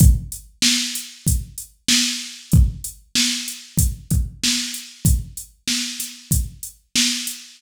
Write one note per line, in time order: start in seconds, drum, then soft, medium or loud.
0.00 kick loud
0.00 closed hi-hat loud
0.32 closed hi-hat medium
0.62 snare loud
0.95 closed hi-hat medium
1.27 kick medium
1.27 closed hi-hat loud
1.58 closed hi-hat medium
1.88 snare loud
2.52 kick loud
2.52 closed hi-hat medium
2.84 closed hi-hat medium
3.15 snare loud
3.48 closed hi-hat medium
3.78 kick loud
3.78 closed hi-hat loud
4.11 kick loud
4.11 closed hi-hat medium
4.44 snare loud
4.74 closed hi-hat medium
5.05 kick loud
5.05 closed hi-hat loud
5.37 closed hi-hat medium
5.68 snare loud
6.00 snare medium
6.00 closed hi-hat loud
6.31 kick medium
6.31 closed hi-hat loud
6.63 closed hi-hat medium
6.96 snare loud
7.27 closed hi-hat medium